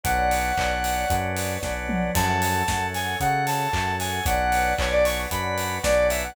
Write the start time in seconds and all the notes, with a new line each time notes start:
0.04 B1 B3 C#4 D4 F#4 B4 C#5 D5 F#5, kick, closed hi-hat
0.31 open hi-hat
0.57 B1 B3 C#4 D4 F#4, kick, clap
0.84 open hi-hat
1.10 F#2 B3 C#4 D4 F#4, kick, closed hi-hat
1.37 open hi-hat
1.63 B1 B3 C#4 D4 F#4, kick, snare
1.89 mid tom
2.14 F#2 A3 C#4 F#4 A4 C#5 F#5 A5, kick, crash
2.42 open hi-hat
2.68 F#2 A3 C#4 F#4, kick, snare
2.95 G#5, open hi-hat
3.20 C#3 A3 C#4 F#4 F#5, kick, closed hi-hat
3.47 A5, open hi-hat
3.73 F#2 A3 C#4 F#4, kick, clap
3.99 G#5, snare, open hi-hat
4.26 B1 B3 C#4 D4 F#4 B4 C#5 D5 F#5, kick, closed hi-hat
4.52 open hi-hat
4.78 B1 B3 C#4 D4 F#4 C#5, kick, clap
4.92 D5
5.05 C#6, open hi-hat
5.30 F#2 B3 C#4 D4 F#4 B5, kick, closed hi-hat
5.58 open hi-hat
5.83 B1 B3 C#4 D4 F#4 D5, kick, snare
6.10 E5, snare, open hi-hat
6.23 F#5